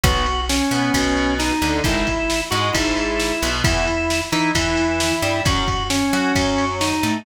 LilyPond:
<<
  \new Staff \with { instrumentName = "Drawbar Organ" } { \time 4/4 \key e \major \tempo 4 = 133 fis'4 cis'2 dis'4 | e'4. fis'8 e'2 | e'4. dis'8 e'2 | fis'4 cis'2 dis'4 | }
  \new Staff \with { instrumentName = "Overdriven Guitar" } { \time 4/4 \key e \major <fis b>8 r4 b8 b,4. d8 | <dis gis>8 r4 gis8 gis,4. b,8 | <e b>8 r4 e'8 e4. g8 | <fis cis'>8 r4 fis'8 fis4. a8 | }
  \new Staff \with { instrumentName = "Electric Bass (finger)" } { \clef bass \time 4/4 \key e \major b,,4. b,8 b,,4. d,8 | gis,,4. gis,8 gis,,4. b,,8 | e,4. e8 e,4. g,8 | fis,4. fis8 fis,4. a,8 | }
  \new DrumStaff \with { instrumentName = "Drums" } \drummode { \time 4/4 <bd cymr>8 cymr8 sn8 cymr8 <bd cymr>8 cymr8 sn8 cymr8 | <bd cymr>8 <bd cymr>8 sn8 cymr8 <bd cymr>8 cymr8 sn8 cymr8 | <bd cymr>8 cymr8 sn8 cymr8 <bd cymr>8 cymr8 sn8 cymr8 | <bd cymr>8 <bd cymr>8 sn8 cymr8 <bd cymr>8 cymr8 sn8 cymr8 | }
>>